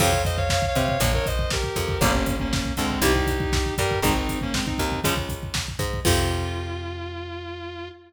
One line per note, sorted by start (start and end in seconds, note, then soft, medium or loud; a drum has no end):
0.00 0.63 F2 loud
0.00 0.10 C3 loud
0.00 0.10 F3 loud
0.00 0.22 C#5 loud
0.00 0.22 F5 loud
0.00 kick medium
0.00 crash loud
0.13 kick medium
0.25 0.37 C5 medium
0.25 0.37 D#5 loud
0.25 kick medium
0.25 closed hi-hat medium
0.37 0.49 C#5 medium
0.37 0.49 F5 loud
0.37 kick medium
0.50 0.66 C#5 loud
0.50 0.66 F5 loud
0.50 kick medium
0.50 snare loud
0.62 kick medium
0.68 0.83 C#5 medium
0.68 0.83 F5 loud
0.75 0.97 C3 medium
0.75 0.97 C4 medium
0.75 kick medium
0.75 closed hi-hat medium
0.84 0.99 C#5 medium
0.84 0.99 F5 loud
0.88 kick medium
1.00 1.64 A#1 medium
1.00 1.11 A#2 loud
1.00 1.11 F3 loud
1.00 1.13 A#4 medium
1.00 1.13 C#5 medium
1.00 kick medium
1.00 closed hi-hat loud
1.13 1.26 A#4 medium
1.13 1.26 C#5 loud
1.13 kick medium
1.26 1.49 C5 medium
1.26 1.49 D#5 medium
1.26 kick medium
1.26 closed hi-hat medium
1.39 kick medium
1.50 2.01 G4 medium
1.50 2.01 A#4 medium
1.50 kick medium
1.50 snare loud
1.63 kick medium
1.76 1.97 F2 medium
1.76 1.98 F3 medium
1.76 kick medium
1.76 closed hi-hat medium
1.88 kick medium
2.01 2.65 G1 loud
2.01 2.12 A#2 loud
2.01 2.12 C#3 loud
2.01 2.12 G3 loud
2.01 2.36 A#3 medium
2.01 2.36 C#4 loud
2.01 kick loud
2.01 closed hi-hat medium
2.14 kick medium
2.26 kick medium
2.26 closed hi-hat medium
2.39 2.73 A#3 medium
2.39 2.73 C#4 medium
2.39 kick medium
2.53 kick loud
2.53 snare loud
2.65 kick medium
2.77 3.00 D2 medium
2.77 2.99 D3 medium
2.77 3.01 G#3 medium
2.77 3.01 C4 loud
2.77 kick medium
2.77 closed hi-hat medium
2.90 kick medium
3.02 3.66 C2 loud
3.02 3.13 C3 loud
3.02 3.13 G3 loud
3.02 3.27 D#4 loud
3.02 3.27 G4 loud
3.02 kick medium
3.02 closed hi-hat loud
3.15 kick medium
3.27 3.74 D#4 medium
3.27 3.74 G4 loud
3.27 kick medium
3.27 closed hi-hat medium
3.40 kick medium
3.53 kick loud
3.53 snare loud
3.66 kick medium
3.78 4.00 G2 medium
3.78 4.00 G3 medium
3.78 3.99 G4 loud
3.78 3.99 A#4 loud
3.78 kick medium
3.78 closed hi-hat medium
3.91 kick medium
4.02 4.67 G#1 medium
4.02 4.13 D#3 loud
4.02 4.13 G#3 loud
4.02 4.39 C4 medium
4.02 4.39 D#4 loud
4.02 kick loud
4.02 closed hi-hat medium
4.16 kick medium
4.29 kick medium
4.29 closed hi-hat medium
4.41 4.54 A#3 medium
4.41 4.54 C#4 loud
4.41 kick medium
4.54 4.66 G#3 medium
4.54 4.66 C4 medium
4.54 kick medium
4.54 snare loud
4.66 5.00 C4 medium
4.66 5.00 D#4 medium
4.66 kick medium
4.78 5.01 D#2 medium
4.78 5.01 D#3 medium
4.78 kick medium
4.78 closed hi-hat medium
4.92 kick medium
5.04 5.69 C#2 medium
5.04 5.14 C#3 loud
5.04 5.14 F3 loud
5.04 5.14 G#3 loud
5.04 kick medium
5.04 closed hi-hat loud
5.17 kick medium
5.29 kick medium
5.29 closed hi-hat medium
5.43 kick medium
5.54 kick medium
5.54 snare loud
5.68 kick medium
5.79 6.00 G#2 medium
5.79 6.01 G#3 medium
5.79 kick medium
5.79 closed hi-hat medium
5.93 kick medium
6.05 7.90 F2 loud
6.05 7.88 C3 medium
6.05 7.88 F3 loud
6.05 7.88 F4 loud
6.05 kick loud
6.05 crash loud